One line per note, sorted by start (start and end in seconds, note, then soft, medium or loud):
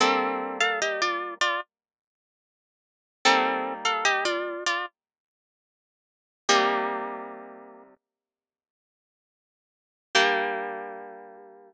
0.00 3.18 G3 medium
0.00 3.18 A#3 medium
0.00 0.58 C4 medium
0.00 3.18 D4 medium
0.00 0.58 A4 medium
0.60 0.80 A4 medium
0.60 0.80 F5 medium
0.82 1.01 G4 medium
0.82 1.01 D#5 medium
1.02 1.34 F4 medium
1.02 1.34 D5 medium
1.41 1.60 F4 medium
1.41 1.60 D5 medium
3.25 6.44 G3 medium
3.25 6.44 A#3 medium
3.25 3.74 C4 medium
3.25 6.44 D#4 medium
3.25 3.74 A4 loud
3.85 4.04 A4 medium
3.85 4.04 F5 medium
4.05 4.24 G4 medium
4.05 4.24 D#5 medium
4.25 4.64 F4 medium
4.25 4.64 D5 medium
4.66 4.86 F4 medium
4.66 4.86 D5 medium
6.49 10.07 C3 medium
6.49 10.07 G3 medium
6.49 8.70 A#3 medium
6.49 10.07 D#4 medium
6.49 8.70 G4 medium
10.15 11.73 G3 loud
10.15 11.73 A#3 loud
10.15 11.73 D4 medium
10.15 11.73 G4 loud